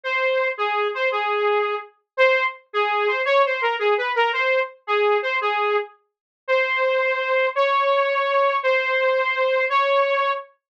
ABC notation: X:1
M:6/8
L:1/16
Q:3/8=112
K:Abmix
V:1 name="Lead 2 (sawtooth)"
c6 A4 c2 | A8 z4 | c3 z3 A4 c2 | d2 c2 B2 A2 _c2 B2 |
c3 z3 A4 c2 | A4 z8 | c12 | d12 |
c12 | d8 z4 |]